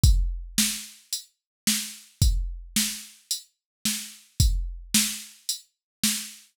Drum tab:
HH |x---x---|x---x---|x---x---|
SD |--o---o-|--o---o-|--o---o-|
BD |o-------|o-------|o-------|